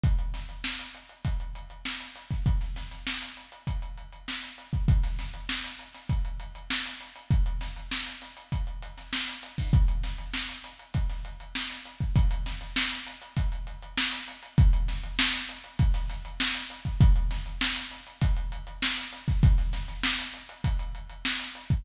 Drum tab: HH |xxxx-xxxxxxx-xxx|xxxx-xxxxxxx-xxx|xxxx-xxxxxxx-xxx|xxxx-xxxxxxx-xxo|
SD |--o-o-------o-oo|-oooo-------o---|-oo-o--o----ooo-|--o-o-o----oo---|
BD |o-------o------o|o-------o------o|o-------o-------|o-------o------o|

HH |xxxx-xxxxxxx-xxx|xxxx-xxxxxxx-xxx|xxxx-xxxxxxx-xxx|xxxx-xxxxxxx-xxx|
SD |--o-o----o--oo--|--ooo-------o---|--o-o----oo-o---|--o-o-------o-oo|
BD |o-------o------o|o-------o-------|o-------o------o|o-------o------o|

HH |xxxx-xxxxxxx-xxx|
SD |-oooo-------o---|
BD |o-------o------o|